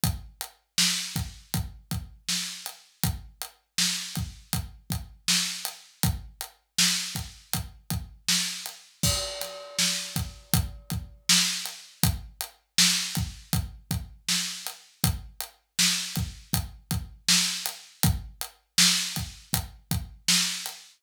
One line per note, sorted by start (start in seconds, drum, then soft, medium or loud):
0.03 kick medium
0.03 closed hi-hat medium
0.41 closed hi-hat medium
0.78 snare loud
1.16 kick medium
1.16 closed hi-hat medium
1.54 kick medium
1.54 closed hi-hat medium
1.91 kick medium
1.91 closed hi-hat medium
2.28 snare medium
2.66 closed hi-hat medium
3.03 kick medium
3.03 closed hi-hat medium
3.42 closed hi-hat medium
3.78 snare medium
4.15 kick medium
4.15 closed hi-hat medium
4.53 kick medium
4.53 closed hi-hat medium
4.90 kick medium
4.90 closed hi-hat medium
5.28 snare medium
5.65 closed hi-hat medium
6.03 kick medium
6.03 closed hi-hat medium
6.41 closed hi-hat medium
6.78 snare loud
7.15 kick medium
7.15 closed hi-hat medium
7.53 kick medium
7.53 closed hi-hat medium
7.90 kick medium
7.90 closed hi-hat medium
8.28 snare medium
8.66 closed hi-hat medium
9.03 kick medium
9.03 crash medium
9.41 snare soft
9.41 closed hi-hat medium
9.79 snare medium
10.16 kick medium
10.16 closed hi-hat medium
10.53 kick medium
10.53 closed hi-hat medium
10.90 kick medium
10.90 closed hi-hat medium
11.29 snare loud
11.65 closed hi-hat medium
12.03 kick medium
12.03 closed hi-hat medium
12.41 closed hi-hat medium
12.78 snare loud
13.15 kick medium
13.15 closed hi-hat medium
13.53 kick medium
13.53 closed hi-hat medium
13.91 kick medium
13.91 closed hi-hat medium
14.28 snare medium
14.67 closed hi-hat medium
15.04 kick medium
15.04 closed hi-hat medium
15.40 closed hi-hat medium
15.79 snare loud
16.16 kick medium
16.16 closed hi-hat medium
16.53 kick medium
16.53 closed hi-hat medium
16.91 kick medium
16.91 closed hi-hat medium
17.28 snare loud
17.66 closed hi-hat medium
18.03 kick loud
18.03 closed hi-hat medium
18.41 closed hi-hat medium
18.78 snare loud
19.16 kick medium
19.16 closed hi-hat medium
19.53 kick medium
19.53 closed hi-hat medium
19.91 kick medium
19.91 closed hi-hat medium
20.28 snare loud
20.66 closed hi-hat medium